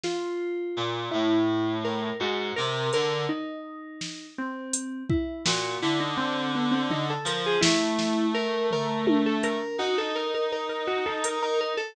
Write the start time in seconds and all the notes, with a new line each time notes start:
0.03 F4, snare
0.77 A#2
1.11 A2 E4
1.84 A#4
2.19 G#2 F#4
2.56 C3 A#4
2.93 D3 A#4, closed hi-hat
3.29 D#4
4.01 snare
4.38 C4
4.73 closed hi-hat
5.09 E4, kick
5.45 A#2 F#4, snare
5.82 D3 E4
6.00 D#4
6.17 C4
6.55 B3
6.71 C4
6.90 D#4, floor tom
7.10 A4
7.25 F3 A#4, closed hi-hat
7.46 G#4
7.61 A3 E4, snare
7.99 snare
8.34 A#4
8.71 A#4, floor tom
9.07 high tom
9.26 A4
9.43 A#4, closed hi-hat
9.78 D#4 F#4
9.98 A4
10.15 A#4
10.34 A#4
10.52 A#4
10.69 A#4
10.87 F#4
11.06 A4
11.24 A#4, closed hi-hat
11.42 A#4
11.61 A#4
11.77 A4